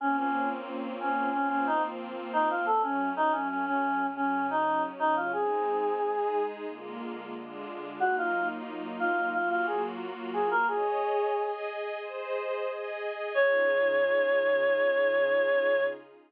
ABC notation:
X:1
M:4/4
L:1/16
Q:1/4=90
K:Db
V:1 name="Choir Aahs"
D D2 z3 D2 D D E z3 E F | =A D2 E D D D3 D2 E2 z E F | A8 z8 | G F2 z3 F2 F F A z3 A B |
A6 z10 | d16 |]
V:2 name="Pad 2 (warm)"
[B,CDF]8 [F,B,CF]8 | [G,=A,D]8 [D,G,D]8 | [A,CE]4 [A,EA]4 [=D,A,B,F]4 [D,A,=DF]4 | [G,B,EF]8 [G,B,FG]8 |
[Ade]4 [Aea]4 [Ace]4 [Aea]4 | [D,EFA]16 |]